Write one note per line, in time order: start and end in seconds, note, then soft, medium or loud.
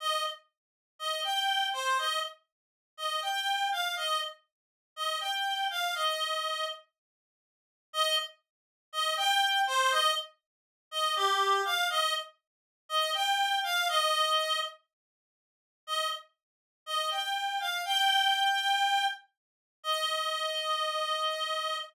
0.00 0.23 D#5 medium
0.99 1.21 D#5 medium
1.24 1.67 G5 medium
1.73 1.98 C5 medium
1.98 2.19 D#5 medium
2.97 3.21 D#5 medium
3.22 3.68 G5 medium
3.72 3.95 F5 medium
3.97 4.20 D#5 medium
4.96 5.18 D#5 medium
5.21 5.66 G5 medium
5.70 5.95 F5 medium
5.95 6.66 D#5 medium
7.93 8.16 D#5 loud
8.93 9.15 D#5 loud
9.17 9.60 G5 loud
9.67 9.91 C5 loud
9.91 10.13 D#5 loud
10.91 11.15 D#5 medium
11.16 11.62 G4 loud
11.65 11.88 F5 loud
11.90 12.13 D#5 loud
12.89 13.11 D#5 loud
13.14 13.59 G5 loud
13.64 13.88 F5 loud
13.89 14.59 D#5 loud
15.87 16.08 D#5 medium
16.86 17.10 D#5 medium
17.11 17.59 G5 medium
17.60 17.83 F5 medium
17.85 19.04 G5 loud
19.83 21.76 D#5 loud